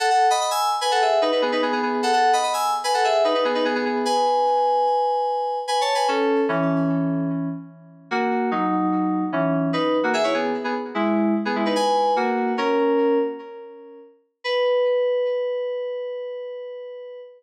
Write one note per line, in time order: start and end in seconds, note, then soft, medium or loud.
0.00 0.10 A4 medium
0.00 0.10 F#5 loud
0.10 0.26 A4 medium
0.10 0.26 F#5 loud
0.30 0.40 D#5 medium
0.30 0.40 B5 loud
0.41 0.50 D#5 medium
0.41 0.50 B5 medium
0.51 0.70 G#5 medium
0.51 0.70 E6 loud
0.81 0.91 B4 medium
0.81 0.91 G#5 loud
0.91 1.01 A4 medium
0.91 1.01 F#5 loud
1.01 1.19 G#4 medium
1.01 1.19 E5 medium
1.22 1.31 D#4 medium
1.22 1.31 B4 medium
1.32 1.41 D#4 medium
1.32 1.41 B4 medium
1.42 1.52 B3 medium
1.42 1.52 G#4 medium
1.52 1.62 D#4 medium
1.52 1.62 B4 loud
1.62 1.72 B3 medium
1.62 1.72 G#4 medium
1.72 1.82 B3 medium
1.72 1.82 G#4 loud
1.82 2.01 B3 medium
1.82 2.01 G#4 medium
2.03 2.12 A4 loud
2.03 2.12 F#5 loud
2.13 2.31 A4 medium
2.13 2.31 F#5 loud
2.33 2.43 D#5 medium
2.33 2.43 B5 loud
2.43 2.53 D#5 medium
2.43 2.53 B5 medium
2.53 2.71 G#5 medium
2.53 2.71 E6 medium
2.84 2.93 B4 medium
2.84 2.93 G#5 loud
2.94 3.04 A4 medium
2.94 3.04 F#5 loud
3.04 3.23 G#4 medium
3.04 3.23 E5 loud
3.24 3.34 D#4 medium
3.24 3.34 B4 medium
3.34 3.44 D#4 medium
3.34 3.44 B4 medium
3.45 3.54 B3 medium
3.45 3.54 G#4 loud
3.55 3.64 D#4 medium
3.55 3.64 B4 loud
3.65 3.74 B3 medium
3.65 3.74 G#4 loud
3.75 3.85 B3 medium
3.75 3.85 G#4 loud
3.85 4.02 B3 medium
3.85 4.02 G#4 medium
4.05 5.59 B4 medium
4.05 5.59 G#5 loud
5.68 5.80 B4 medium
5.68 5.80 G#5 medium
5.81 5.94 C#5 medium
5.81 5.94 A5 medium
5.95 6.07 B4 medium
5.95 6.07 G#5 medium
6.08 6.41 C#4 loud
6.08 6.41 A4 loud
6.49 7.49 E3 medium
6.49 7.49 C#4 loud
8.11 8.50 A#3 loud
8.11 8.50 F#4 loud
8.51 9.24 F#3 medium
8.51 9.24 D#4 loud
9.32 9.70 E3 medium
9.32 9.70 C#4 medium
9.73 9.98 D#4 medium
9.73 9.98 B4 medium
10.03 10.13 A#3 medium
10.03 10.13 F#4 medium
10.14 10.23 G#4 medium
10.14 10.23 E5 loud
10.24 10.33 E4 medium
10.24 10.33 C#5 medium
10.34 10.53 B3 medium
10.34 10.53 G#4 medium
10.64 10.74 B3 medium
10.64 10.74 G#4 medium
10.95 11.34 G#3 medium
10.95 11.34 E4 medium
11.45 11.55 B3 medium
11.45 11.55 G#4 medium
11.55 11.65 G#3 medium
11.55 11.65 E4 medium
11.66 11.75 D#4 medium
11.66 11.75 B4 medium
11.76 12.13 B4 medium
11.76 12.13 G#5 loud
12.16 12.53 A#3 medium
12.16 12.53 F#4 medium
12.58 13.18 C#4 medium
12.58 13.18 A#4 loud
14.44 17.20 B4 loud